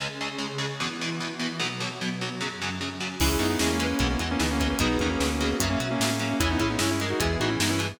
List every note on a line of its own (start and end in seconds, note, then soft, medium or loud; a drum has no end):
0.00 0.08 C#2 medium
0.00 0.08 C#3 medium
0.00 0.79 C#3 medium
0.00 0.08 G#3 medium
0.00 0.79 C#4 medium
0.00 0.79 G#4 medium
0.21 0.29 C#2 medium
0.21 0.29 C#3 medium
0.21 0.29 G#3 medium
0.38 0.46 C#2 medium
0.38 0.46 C#3 medium
0.38 0.46 G#3 medium
0.58 0.66 C#2 medium
0.58 0.66 C#3 medium
0.58 0.66 G#3 medium
0.80 0.88 E2 loud
0.80 0.88 B2 medium
0.80 1.59 E3 medium
0.80 0.88 E3 medium
0.80 1.59 B3 medium
0.80 1.59 E4 medium
1.01 1.09 E2 medium
1.01 1.09 B2 medium
1.01 1.09 E3 medium
1.20 1.28 E2 medium
1.20 1.28 B2 medium
1.20 1.28 E3 medium
1.40 1.48 E2 medium
1.40 1.48 B2 medium
1.40 1.48 E3 medium
1.60 1.68 B1 loud
1.60 1.68 B2 medium
1.60 2.39 B2 medium
1.60 1.68 F#3 loud
1.60 2.39 F#3 medium
1.60 2.39 B3 medium
1.80 1.88 B1 medium
1.80 1.88 B2 medium
1.80 1.88 F#3 medium
2.01 2.09 B1 medium
2.01 2.09 B2 medium
2.01 2.09 F#3 medium
2.21 2.29 B1 medium
2.21 2.29 B2 medium
2.21 2.29 F#3 medium
2.40 3.19 F#2 medium
2.40 2.49 F#2 medium
2.40 2.49 C#3 medium
2.40 3.19 F#3 medium
2.40 2.49 F#3 loud
2.40 3.19 C#4 medium
2.62 2.70 F#2 medium
2.62 2.70 C#3 medium
2.62 2.70 F#3 medium
2.81 2.89 F#2 medium
2.81 2.89 C#3 medium
2.81 2.89 F#3 medium
3.00 3.08 F#2 medium
3.00 3.08 C#3 medium
3.00 3.08 F#3 medium
3.20 3.37 C#2 medium
3.20 3.29 C#3 medium
3.20 3.29 E3 loud
3.20 3.29 G#3 medium
3.20 3.60 C#4 medium
3.20 3.38 C#4 medium
3.20 3.60 E4 medium
3.20 3.77 E4 medium
3.20 3.38 E4 medium
3.20 3.60 G#4 medium
3.20 3.77 G#4 medium
3.20 kick medium
3.20 crash loud
3.39 3.57 F#2 medium
3.39 3.47 C#3 medium
3.39 3.47 E3 medium
3.39 3.47 G#3 medium
3.39 3.49 B3 medium
3.39 3.49 D#4 medium
3.39 closed hi-hat medium
3.49 3.59 B3 medium
3.49 3.59 D#4 medium
3.59 3.94 E2 medium
3.59 3.69 C#3 medium
3.59 3.69 E3 medium
3.59 4.00 G#3 medium
3.59 3.69 G#3 medium
3.59 3.69 A#3 medium
3.59 3.69 C#4 medium
3.59 4.00 C#4 medium
3.59 4.00 G#4 medium
3.59 snare loud
3.69 4.08 A#3 medium
3.69 4.08 C#4 medium
3.80 3.88 C#3 medium
3.80 3.88 E3 medium
3.80 3.88 G#3 medium
3.80 3.98 B4 medium
3.80 closed hi-hat medium
3.99 4.17 B1 medium
3.99 4.08 B2 medium
3.99 4.08 E3 loud
3.99 4.08 G#3 medium
3.99 4.40 B3 medium
3.99 4.64 B3 medium
3.99 4.40 E4 medium
3.99 4.40 G#4 medium
3.99 kick medium
3.99 closed hi-hat medium
4.10 4.20 A#3 medium
4.10 4.20 C#4 medium
4.19 4.37 E2 medium
4.19 4.28 B2 medium
4.19 4.28 E3 medium
4.19 4.28 G#3 medium
4.19 closed hi-hat medium
4.31 4.40 A#3 medium
4.31 4.40 C#4 medium
4.39 4.74 D2 medium
4.39 4.47 B2 medium
4.39 4.47 E3 medium
4.39 4.47 G#3 medium
4.39 4.79 B3 medium
4.39 4.50 B3 medium
4.39 4.50 D#4 medium
4.39 4.80 G#4 soft
4.39 4.80 B4 medium
4.39 snare loud
4.51 4.60 A#3 medium
4.51 4.60 C#4 medium
4.60 4.68 B2 medium
4.60 4.68 E3 medium
4.60 4.68 G#3 medium
4.60 4.69 A#3 medium
4.60 4.69 C#4 medium
4.60 kick medium
4.60 closed hi-hat medium
4.70 4.79 A#3 medium
4.70 4.79 C#4 medium
4.79 4.97 B1 medium
4.79 4.88 B2 loud
4.79 4.88 D#3 medium
4.79 4.88 F#3 loud
4.79 4.98 B3 medium
4.79 5.20 B3 medium
4.79 4.98 D#4 medium
4.79 5.20 D#4 medium
4.79 5.20 F#4 medium
4.79 5.30 G#4 medium
4.79 5.30 B4 medium
4.79 kick loud
4.79 closed hi-hat loud
4.99 5.17 E2 medium
4.99 5.09 B2 medium
4.99 5.09 D#3 medium
4.99 5.09 F#3 medium
4.99 5.09 A#3 medium
4.99 5.09 C#4 medium
4.99 kick medium
4.99 closed hi-hat medium
5.10 5.19 A#3 medium
5.10 5.19 C#4 medium
5.20 5.54 D2 medium
5.20 5.28 B2 medium
5.20 5.28 D#3 medium
5.20 5.28 F#3 medium
5.20 5.29 A#3 medium
5.20 5.60 B3 medium
5.20 5.29 C#4 medium
5.20 5.60 F#4 medium
5.20 5.60 B4 medium
5.20 snare loud
5.30 5.67 A#3 medium
5.30 5.67 C#4 medium
5.40 5.49 B2 medium
5.40 5.49 D#3 medium
5.40 5.49 F#3 medium
5.40 5.57 G#4 medium
5.40 closed hi-hat medium
5.60 5.77 F#2 medium
5.60 5.69 C#3 loud
5.60 5.69 F#3 medium
5.60 6.39 C#4 medium
5.60 6.39 F#4 medium
5.60 6.36 E5 medium
5.60 kick medium
5.60 closed hi-hat loud
5.69 5.79 A#3 medium
5.69 5.79 C#4 medium
5.80 5.97 B2 medium
5.80 5.88 C#3 medium
5.80 5.88 F#3 medium
5.80 closed hi-hat medium
5.91 5.99 A#3 medium
5.91 5.99 C#4 loud
6.00 6.34 A2 medium
6.00 6.09 C#3 medium
6.00 6.09 F#3 medium
6.00 6.09 A#3 medium
6.00 6.09 C#4 medium
6.00 snare loud
6.10 6.19 A#3 medium
6.10 6.19 C#4 medium
6.19 6.28 C#3 medium
6.19 6.28 F#3 medium
6.19 6.30 A#3 medium
6.19 6.30 C#4 medium
6.19 closed hi-hat medium
6.30 6.40 A#3 medium
6.30 6.39 C#4 medium
6.40 6.57 E2 medium
6.40 6.48 C#3 medium
6.40 6.48 E3 loud
6.40 6.48 G#3 loud
6.40 6.49 C#4 medium
6.40 6.80 C#4 medium
6.40 6.91 C#4 medium
6.40 6.49 E4 medium
6.40 6.80 E4 medium
6.40 6.91 E4 medium
6.40 6.80 G#4 medium
6.40 kick medium
6.40 closed hi-hat loud
6.50 6.60 B3 medium
6.50 6.60 D#4 medium
6.59 6.77 A2 medium
6.59 6.67 C#3 medium
6.59 6.67 E3 medium
6.59 6.67 G#3 medium
6.59 6.70 C#4 medium
6.59 6.70 E4 medium
6.59 kick medium
6.59 closed hi-hat medium
6.70 6.79 B3 medium
6.70 6.79 D#4 medium
6.79 7.14 G2 medium
6.79 6.87 C#3 medium
6.79 6.87 E3 medium
6.79 6.87 G#3 medium
6.79 7.20 G#3 medium
6.79 7.20 C#4 medium
6.79 6.90 C#4 medium
6.79 6.90 E4 loud
6.79 7.20 G#4 medium
6.79 snare loud
6.91 7.00 C#4 medium
6.91 7.00 E4 medium
7.00 7.09 C#3 medium
7.00 7.09 E3 medium
7.00 7.09 G#3 medium
7.00 7.17 A#4 medium
7.00 closed hi-hat medium
7.10 7.20 D#4 medium
7.10 7.20 F#4 medium
7.20 7.37 E2 medium
7.20 7.28 B2 medium
7.20 7.28 E3 medium
7.20 7.89 E3 medium
7.20 7.28 G#3 medium
7.20 7.60 B3 medium
7.20 7.60 E4 medium
7.20 7.38 E4 medium
7.20 7.60 G#4 medium
7.20 7.38 G#4 medium
7.20 kick medium
7.20 closed hi-hat loud
7.40 7.57 A2 medium
7.40 7.49 B2 medium
7.40 7.49 E3 medium
7.40 7.49 G#3 medium
7.40 7.50 D#4 medium
7.40 7.50 F#4 medium
7.40 closed hi-hat medium
7.49 7.59 C#4 medium
7.49 7.59 E4 medium
7.60 7.94 G2 medium
7.60 7.69 B2 medium
7.60 7.69 E3 medium
7.60 7.69 G#3 medium
7.60 7.99 B3 medium
7.60 7.70 B3 medium
7.60 7.70 D#4 medium
7.60 7.99 G#4 medium
7.60 7.99 B4 soft
7.60 snare loud
7.70 7.80 C#4 medium
7.70 7.80 E4 medium
7.79 7.87 B2 medium
7.79 7.87 E3 medium
7.79 7.87 G#3 medium
7.79 closed hi-hat medium